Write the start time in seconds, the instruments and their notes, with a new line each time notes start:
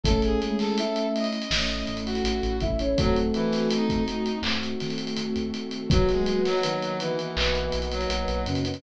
0.04 synth bass 1 A1, flute A3 A4, electric piano 1 A3 C#4 E4, pad 2 (warm) A3 C#4 E4, brass section A4, kick, closed hi-hat
0.22 brass section G#4, closed hi-hat
0.42 flute G#3 G#4, closed hi-hat
0.59 brass section A4, snare, closed hi-hat
0.78 flute E4 E5, closed hi-hat
0.96 closed hi-hat
1.15 brass section D#5, closed hi-hat
1.24 closed hi-hat
1.32 closed hi-hat
1.42 closed hi-hat
1.50 synth bass 1 A1, pad 2 (warm) A3 E4 A4, electric piano 1 A3 C#4 E4, snare
1.69 closed hi-hat
1.87 synth bass 1 A1, closed hi-hat
1.97 closed hi-hat
2.05 brass section F#4, closed hi-hat
2.15 closed hi-hat
2.24 synth bass 1 A1, closed hi-hat
2.43 synth bass 1 A1, closed hi-hat
2.60 synth bass 1 A1, flute E4 E5, kick, closed hi-hat
2.79 flute C#4 C#5, closed hi-hat
2.97 synth bass 1 D#2, brass section F#3, pad 2 (warm) A3 C4 D#4 F#4, flute A3 A4, electric piano 1 A3 C4 D#4 F#4, kick, closed hi-hat
3.16 closed hi-hat
3.34 brass section E3, closed hi-hat
3.52 snare, closed hi-hat
3.70 brass section D#4, closed hi-hat
3.89 kick, closed hi-hat
4.08 closed hi-hat
4.26 closed hi-hat
4.42 synth bass 1 D#2, electric piano 1 A3 C4 D#4 F#4, pad 2 (warm) A3 C4 F#4 A4, clap
4.63 closed hi-hat
4.80 synth bass 1 D#3, snare, closed hi-hat
4.90 closed hi-hat
4.98 closed hi-hat
5.07 closed hi-hat
5.16 synth bass 1 D#2, closed hi-hat
5.36 synth bass 1 D#2, closed hi-hat
5.54 synth bass 1 D#3, closed hi-hat
5.71 closed hi-hat
5.90 synth bass 1 B1, flute F#3 F#4, brass section F#3, electric piano 1 A#3 B3 D#4 F#4, pad 2 (warm) A#4 B4 D#5 F#5, kick, closed hi-hat
6.09 brass section G#3, snare, closed hi-hat
6.26 flute F#3 F#4, closed hi-hat
6.45 brass section F#3, snare, closed hi-hat
6.63 flute D#3 D#4, electric piano 1 A#3 B3 D#4 F#4, closed hi-hat
6.82 closed hi-hat
7.00 brass section E3, closed hi-hat
7.19 closed hi-hat
7.36 synth bass 1 B1, electric piano 1 A#3 B3 D#4 F#4, clap
7.55 closed hi-hat
7.72 synth bass 1 B1, closed hi-hat
7.82 closed hi-hat
7.91 brass section F#3, closed hi-hat
8.01 closed hi-hat
8.09 synth bass 1 B1, electric piano 1 A#3 B3 D#4 F#4, closed hi-hat
8.28 synth bass 1 B1, closed hi-hat
8.46 synth bass 1 F#2, flute C#3 C#4, closed hi-hat
8.55 closed hi-hat
8.65 flute C#3 C#4, closed hi-hat
8.74 closed hi-hat